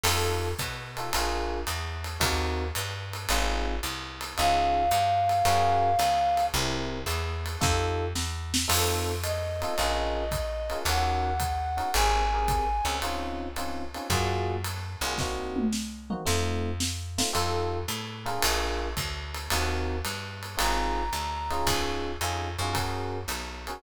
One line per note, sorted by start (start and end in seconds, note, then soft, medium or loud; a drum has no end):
0.03 0.54 F2 loud
0.03 0.48 D#4 loud
0.03 0.48 F4 loud
0.03 0.48 G4 loud
0.03 0.48 A4 loud
0.03 crash medium
0.03 ride loud
0.59 1.10 B2 medium
0.59 kick medium
0.59 hi-hat pedal medium
0.59 ride medium
0.97 1.09 D#4 medium
0.97 1.09 F4 medium
0.97 1.09 G4 medium
0.97 1.09 A4 loud
0.97 ride medium
1.13 1.65 A#1 medium
1.13 1.58 D4 loud
1.13 1.58 F4 loud
1.13 1.58 G#4 loud
1.13 1.58 A#4 loud
1.13 ride loud
1.67 2.18 E2 medium
1.67 hi-hat pedal medium
1.67 ride medium
2.04 ride medium
2.20 2.72 D#2 medium
2.20 2.64 C4 loud
2.20 2.64 D#4 loud
2.20 2.64 F#4 loud
2.20 2.64 A#4 loud
2.20 kick medium
2.20 ride loud
2.75 3.27 G2 medium
2.75 hi-hat pedal medium
2.75 ride medium
3.13 ride medium
3.29 3.80 G#1 medium
3.29 3.74 C4 loud
3.29 3.74 D#4 loud
3.29 3.74 F4 loud
3.29 3.74 G#4 loud
3.29 ride loud
3.83 4.34 C2 medium
3.83 hi-hat pedal medium
3.83 ride medium
4.21 ride medium
4.37 4.90 C#2 loud
4.37 4.83 C#4 loud
4.37 4.83 D#4 loud
4.37 4.83 F4 loud
4.37 4.83 G#4 loud
4.37 6.45 F5 medium
4.37 ride medium
4.91 5.42 G2 medium
4.91 hi-hat pedal medium
4.91 ride medium
5.29 ride medium
5.45 5.96 F#2 medium
5.45 5.89 C#4 loud
5.45 5.89 F#4 loud
5.45 5.89 G#4 loud
5.45 5.89 A#4 loud
5.45 ride loud
5.99 6.50 C#2 medium
5.99 hi-hat pedal medium
5.99 ride medium
6.37 ride medium
6.54 7.05 C2 loud
6.54 6.98 C4 loud
6.54 6.98 E4 loud
6.54 6.98 G4 loud
6.54 6.98 A#4 loud
6.54 ride medium
7.06 7.57 E2 medium
7.06 hi-hat pedal medium
7.06 ride medium
7.46 ride medium
7.61 8.14 F2 loud
7.61 8.05 D#4 loud
7.61 8.05 F4 loud
7.61 8.05 G4 loud
7.61 8.05 A4 loud
7.61 kick medium
7.61 snare medium
8.15 8.66 E2 medium
8.15 snare medium
8.54 snare loud
8.68 9.64 F2 medium
8.68 9.12 C4 loud
8.68 9.12 D#4 loud
8.68 9.12 F4 loud
8.68 9.12 A4 loud
8.68 crash loud
8.68 ride loud
9.23 10.78 D#5 medium
9.23 hi-hat pedal medium
9.23 ride medium
9.62 9.73 C4 medium
9.62 9.73 D#4 loud
9.62 9.73 F4 loud
9.62 9.73 A4 medium
9.62 ride medium
9.78 10.74 A#1 medium
9.78 10.23 C#4 loud
9.78 10.23 F4 loud
9.78 10.23 G#4 loud
9.78 10.23 A#4 loud
9.78 ride medium
10.31 kick medium
10.31 hi-hat pedal medium
10.31 ride medium
10.70 10.82 C#4 loud
10.70 10.82 F4 medium
10.70 10.82 G#4 medium
10.70 10.82 A#4 medium
10.70 ride medium
10.85 11.80 D#2 medium
10.85 11.30 C#4 loud
10.85 11.30 D#4 loud
10.85 11.30 F#4 loud
10.85 11.30 A#4 loud
10.85 11.91 F#5 soft
10.85 ride loud
11.40 kick medium
11.40 hi-hat pedal medium
11.40 ride medium
11.77 11.89 C#4 medium
11.77 11.89 D#4 loud
11.77 11.89 F#4 medium
11.77 11.89 A#4 loud
11.77 ride medium
11.93 12.81 G#1 loud
11.93 12.21 C4 loud
11.93 12.21 G4 loud
11.93 12.21 G#4 loud
11.93 12.21 A#4 loud
11.93 12.96 G#5 soft
11.93 ride loud
12.34 12.65 C4 medium
12.34 12.65 G4 loud
12.34 12.65 G#4 loud
12.34 12.65 A#4 medium
12.48 kick medium
12.48 hi-hat pedal medium
12.48 ride medium
12.85 13.96 C#2 medium
12.85 12.97 C4 medium
12.85 12.97 G4 medium
12.85 12.97 G#4 medium
12.85 12.97 A#4 loud
12.85 ride medium
13.02 13.47 C4 loud
13.02 13.47 C#4 loud
13.02 13.47 D#4 loud
13.02 13.47 F4 loud
13.02 ride medium
13.56 13.83 C4 loud
13.56 13.83 C#4 medium
13.56 13.83 D#4 medium
13.56 13.83 F4 medium
13.56 hi-hat pedal medium
13.56 ride medium
13.94 14.06 C4 medium
13.94 14.06 C#4 loud
13.94 14.06 D#4 loud
13.94 14.06 F4 medium
13.94 ride medium
14.10 14.96 F#2 loud
14.10 14.55 A#3 loud
14.10 14.55 F4 loud
14.10 14.55 F#4 loud
14.10 14.55 G#4 loud
14.10 kick medium
14.10 ride medium
14.64 hi-hat pedal medium
14.64 ride medium
15.01 16.13 C2 loud
15.01 15.15 A#3 loud
15.01 15.15 F4 loud
15.01 15.15 F#4 loud
15.01 15.15 G#4 medium
15.01 ride medium
15.18 15.64 A#3 loud
15.18 15.64 C4 loud
15.18 15.64 D#4 loud
15.18 15.64 F#4 loud
15.18 kick medium
15.18 snare medium
15.56 high tom medium
15.73 snare medium
16.10 16.22 A#3 loud
16.10 16.22 C4 loud
16.10 16.22 D#4 loud
16.10 16.22 F#4 loud
16.10 mid tom medium
16.25 17.22 F2 loud
16.25 16.70 A3 loud
16.25 16.70 C4 loud
16.25 16.70 D#4 loud
16.25 16.70 F4 loud
16.25 snare medium
16.80 snare medium
17.18 17.29 A3 medium
17.18 17.29 C4 loud
17.18 17.29 D#4 loud
17.18 17.29 F4 loud
17.18 snare loud
17.33 17.86 F2 medium
17.33 17.77 D#4 loud
17.33 17.77 F4 loud
17.33 17.77 G4 loud
17.33 17.77 A4 loud
17.33 ride medium
17.88 18.39 A2 medium
17.88 hi-hat pedal medium
17.88 ride medium
18.26 18.86 D4 loud
18.26 18.86 F4 loud
18.26 18.86 G#4 loud
18.26 18.86 A#4 loud
18.26 ride medium
18.42 18.94 A#1 medium
18.42 ride loud
18.97 19.48 D2 medium
18.97 kick medium
18.97 hi-hat pedal medium
18.97 ride medium
19.34 ride medium
19.50 20.02 D#2 medium
19.50 19.96 C4 loud
19.50 19.96 D#4 loud
19.50 19.96 F#4 loud
19.50 19.96 A#4 loud
19.50 ride loud
20.05 20.56 G2 medium
20.05 hi-hat pedal medium
20.05 ride medium
20.43 ride medium
20.57 21.10 G#1 medium
20.57 21.02 C4 loud
20.57 21.02 D#4 loud
20.57 21.02 F4 loud
20.57 21.02 G#4 loud
20.57 21.67 A#5 medium
20.57 ride loud
21.13 21.63 D2 medium
21.13 hi-hat pedal medium
21.13 ride medium
21.50 22.11 C#4 loud
21.50 22.11 D#4 loud
21.50 22.11 F4 loud
21.50 22.11 G#4 loud
21.50 ride medium
21.67 22.17 C#2 medium
21.67 kick medium
21.67 ride loud
22.21 22.57 F2 medium
22.21 22.48 C#4 medium
22.21 22.48 D#4 loud
22.21 22.48 F4 loud
22.21 22.48 G#4 loud
22.21 hi-hat pedal medium
22.21 ride medium
22.59 23.26 F#2 medium
22.59 22.72 C#4 loud
22.59 22.72 D#4 loud
22.59 22.72 F4 loud
22.59 22.72 G#4 medium
22.59 ride medium
22.73 23.17 C#4 loud
22.73 23.17 F#4 loud
22.73 23.17 G#4 loud
22.73 23.17 A#4 loud
22.73 kick medium
22.73 ride medium
23.28 23.79 B1 medium
23.28 hi-hat pedal medium
23.28 ride medium
23.67 23.79 C#4 medium
23.67 23.79 F#4 loud
23.67 23.79 G#4 loud
23.67 23.79 A#4 medium
23.67 ride medium